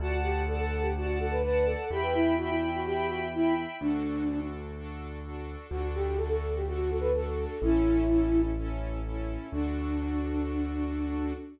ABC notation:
X:1
M:4/4
L:1/16
Q:1/4=126
K:D
V:1 name="Flute"
F z G2 A A2 G F2 A B B2 A2 | G B E2 F E2 F G2 F z E2 z2 | D6 z10 | F z G2 A A2 G F2 A B A2 A2 |
E8 z8 | D16 |]
V:2 name="String Ensemble 1"
[dfa]4 [dfa]4 [dfa]4 [dfa]4 | [egb]4 [egb]4 [egb]4 [egb]4 | [DFA]4 [DFA]4 [DFA]4 [DFA]4 | [DFA]4 [DFA]4 [DFA]4 [DFA]4 |
[CEA]4 [CEA]4 [CEA]4 [CEA]4 | [DFA]16 |]
V:3 name="Acoustic Grand Piano" clef=bass
D,,16 | E,,16 | D,,16 | D,,16 |
A,,,16 | D,,16 |]